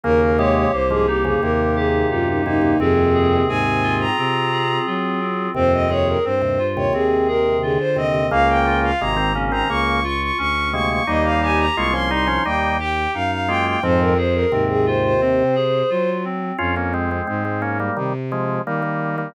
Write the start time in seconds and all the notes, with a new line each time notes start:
0.03 D#2 C#3 A#3 A#4
0.21 A#4
0.38 C3 G#3 G4 C#5
0.56 C#5
0.72 C2 A#3 C5
0.90 G#2 F3 G#4
1.07 D#4 G4
1.24 F2 C#3 G#4
1.42 D#2 C3 A#3 A#4
1.76 G4 G#4
2.10 F#2 D#4 F4
2.28 D#4
2.45 D#2 C3 A#3 D#4
2.61 D#2 C3
2.79 D#2 F2 C3 C4 G#4
3.14 G#4
3.48 G#2 C4 G#5
3.83 F4
4.00 A#5
4.17 C3 C4
4.52 G#4
4.86 F#3 F4
5.21 C4
5.54 D#2 F2 C3 C4 C5
5.73 D#5
5.90 D#2 C3 G#4 C#5
6.07 A#4
6.24 G2 C4 C5
6.42 D#2 C3
6.59 F4
6.76 D#2 C3 C#5
6.93 D#2 C3 C4 G#4
7.28 G#4 A#4
7.62 D3 F4 G#4
7.79 C5
7.96 D#2 C3 C4 D#5
8.14 D#2 C3
8.31 C#2 C#3 A#3 F5
8.49 G5
8.66 F4
8.83 F5
9.00 G#1 C3 G#3 A#3 A#5
9.17 D#3 C4
9.35 C#3 A#3 C#4
9.52 D#3 C4 A#5
9.69 C#2 C#3 A#3 C#6
10.04 F4 C#6
10.21 C#6
10.38 D2 C#4 C#6
10.73 C3 G#3 A#3 C#6
10.90 C#6
11.07 D#2 G3 A#3 D#4 D#5
11.24 F5
11.42 G4 G#5
11.59 A#5
11.76 C2 G#3 A#3 F4 C#6
11.93 F3 C#4 C6
12.10 G3 D#4 C6
12.27 F3 C#4
12.45 D#2 G3 A#3 D#4 G5
12.79 G4 G5
13.14 F#2 D#4 F5
13.31 F5
13.48 G#3 A#3 F4 G5
13.66 G5
13.83 F2 G#2 F3 C4 C5
14.00 A#4
14.18 G#4 C5
14.35 A#4
14.52 D#2 G#2 C3 C4
14.69 G#4
14.86 F4 C5
15.04 C5
15.21 C3 C4
15.55 G#4
15.90 F#3 F4
16.24 C4
16.58 F2 C#4 F4
16.76 A#3 C#4
16.94 G#3 C4
17.11 G#3 C4
17.27 G#2 G#3 C4
17.45 G#3 C4
17.62 A#3 C#4
17.80 G3 A#3
17.97 C3 D#3 G3
18.32 F3 G#3
18.66 D#3 G3 A#3
18.82 G3 A#3
19.18 G3 A#3